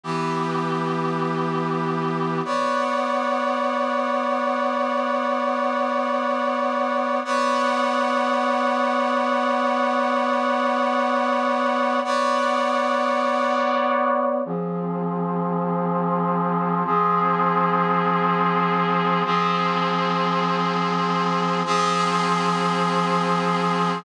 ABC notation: X:1
M:4/4
L:1/8
Q:1/4=100
K:Ephr
V:1 name="Brass Section"
[E,B,G]8 | [K:Bphr] [B,^cdf]8- | [B,^cdf]8 | [B,^cdf]8- |
[B,^cdf]8 | [B,^cdf]8 | [K:Fphr] [F,CA]8 | [F,CA]8 |
[F,CA]8 | [F,CA]8 |]